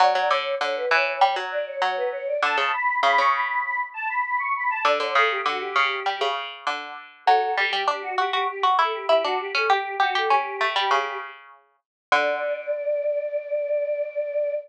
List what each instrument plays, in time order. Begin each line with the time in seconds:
0.00 harpsichord F#3, choir aahs D5
0.14 harpsichord F#3, choir aahs D5
0.30 harpsichord D3, choir aahs C#5
0.61 harpsichord D3, choir aahs C#5
0.75 choir aahs B4
0.90 harpsichord E3, choir aahs C#5
1.07 choir aahs C#5
1.20 harpsichord G3, choir aahs C#5
1.36 harpsichord F#3
1.51 choir aahs D5
1.67 choir aahs C#5
1.82 harpsichord F#3, choir aahs C#5
1.97 choir aahs B4
2.12 choir aahs C#5
2.27 choir aahs D5
2.42 harpsichord D3, choir aahs A5
2.57 harpsichord C#3, choir aahs A5
2.73 choir aahs B5
3.03 harpsichord C#3, choir aahs B5
3.18 harpsichord C#3, choir aahs C#6
3.34 choir aahs B5
3.48 choir aahs B5
3.65 choir aahs B5
3.94 choir aahs A5
4.08 choir aahs B5
4.25 choir aahs B5
4.39 choir aahs C#6
4.56 choir aahs B5
4.70 choir aahs A5
4.85 harpsichord D3, choir aahs D5
5.00 harpsichord D3, choir aahs C#5
5.15 harpsichord C#3, choir aahs A4
5.31 choir aahs G4
5.45 harpsichord D3, choir aahs F#4
5.59 choir aahs G4
5.76 harpsichord C#3
6.06 harpsichord G3
6.21 harpsichord C#3
6.67 harpsichord D3
7.26 harpsichord F#3, choir aahs A4
7.44 choir aahs A4
7.57 harpsichord G3, choir aahs G4
7.73 harpsichord G3
7.88 harpsichord D4, choir aahs G4
8.02 choir aahs F#4
8.18 harpsichord F#4, choir aahs G4
8.32 harpsichord F#4, choir aahs G4
8.48 choir aahs G4
8.63 harpsichord F#4
8.78 harpsichord E4, choir aahs A4
8.92 choir aahs G4
9.08 harpsichord E4, choir aahs G4
9.23 harpsichord D4, choir aahs F#4
9.40 choir aahs G4
9.55 harpsichord C#4, choir aahs A4
9.70 harpsichord G4, choir aahs G4
10.00 choir aahs F#4, harpsichord G4
10.14 harpsichord G4, choir aahs A4
10.30 harpsichord C#4, choir aahs G4
10.61 harpsichord A3
10.76 harpsichord G3
10.91 harpsichord C#3
12.12 harpsichord D3, choir aahs D5